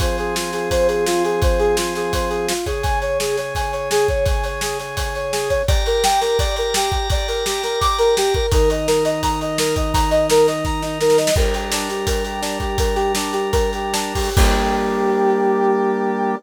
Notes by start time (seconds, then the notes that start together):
0.00 F3 C4 G#4 C5, kick, closed hi-hat
0.18 G#4, closed hi-hat
0.35 F4, snare
0.53 G#4, snare, closed hi-hat
0.71 C5, kick, closed hi-hat
0.88 G#4, closed hi-hat
1.06 F4, snare
1.24 G#4, closed hi-hat
1.42 C5, kick, closed hi-hat
1.59 G#4, closed hi-hat
1.77 F4, snare
1.95 G#4, snare, closed hi-hat
2.13 C5, kick, closed hi-hat
2.30 G#4, closed hi-hat
2.49 F4, snare
2.66 C#3 C#4 G#4, kick, closed hi-hat
2.83 G#5, kick, closed hi-hat
3.02 C#5, closed hi-hat
3.20 G#4, snare
3.37 C#5, snare, closed hi-hat
3.55 G#5, kick, closed hi-hat
3.72 C#5, closed hi-hat
3.91 G#4, snare
4.08 C#5, kick, closed hi-hat
4.26 G#5, kick, closed hi-hat
4.44 C#5, closed hi-hat
4.61 G#4, snare
4.79 C#5, snare, closed hi-hat
4.97 G#5, kick, closed hi-hat
5.15 C#5, closed hi-hat
5.32 G#4, snare
5.50 C#5, kick, closed hi-hat
5.68 G4 D5 A#5, kick, closed hi-hat
5.86 A#4, closed hi-hat
6.04 G5, snare
6.21 A#4, snare, closed hi-hat
6.39 D5, kick, closed hi-hat
6.56 A#4, closed hi-hat
6.74 G4, snare
6.92 G4, kick, closed hi-hat
7.10 D5, kick, closed hi-hat
7.28 A#4, closed hi-hat
7.46 G4, snare
7.63 A#4, snare, closed hi-hat
7.81 D6, kick, closed hi-hat
7.99 A#4, closed hi-hat
8.17 G4, snare
8.34 A#4, kick, closed hi-hat
8.52 D#3 D#4 A#4, kick, closed hi-hat
8.70 D#5, closed hi-hat
8.88 A#4, snare
9.05 D#5, snare, closed hi-hat
9.23 A#5, kick, closed hi-hat
9.41 D#5, closed hi-hat
9.58 A#4, snare
9.76 D#5, kick, closed hi-hat
9.94 A#5, kick, closed hi-hat
10.11 D#5, closed hi-hat
10.30 A#4, snare
10.48 D#5, snare, closed hi-hat
10.65 A#5, kick, snare
10.82 D#4, snare
11.01 A#4, snare
11.10 snare
11.18 D#5, snare
11.27 snare
11.36 G3 D4 A#4, kick, crash
11.54 G4, closed hi-hat
11.72 D4, snare
11.89 G4, snare, closed hi-hat
12.07 A#4, kick, closed hi-hat
12.24 G4, closed hi-hat
12.42 D4, snare
12.60 G4, kick, closed hi-hat
12.78 A#4, kick, closed hi-hat
12.95 G4, closed hi-hat
13.15 D4, snare
13.33 G4, snare, closed hi-hat
13.52 A#4, kick, closed hi-hat
13.73 G4, closed hi-hat
13.93 D4, snare
14.15 G4, kick, open hi-hat
14.36 G3 A#3 D4 G4, kick, crash